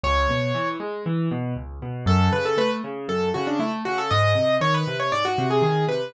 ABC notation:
X:1
M:4/4
L:1/16
Q:1/4=118
K:F#m
V:1 name="Acoustic Grand Piano"
c6 z10 | A2 B A B z3 A2 F D E z F A | ^d4 c B2 c =d F2 G G2 B2 |]
V:2 name="Acoustic Grand Piano"
C,,2 B,,2 E,2 G,2 E,2 B,,2 C,,2 B,,2 | F,,2 C,2 A,2 C,2 F,,2 C,2 A,2 C,2 | G,,2 ^B,,2 ^D,2 B,,2 G,,2 B,,2 D,2 B,,2 |]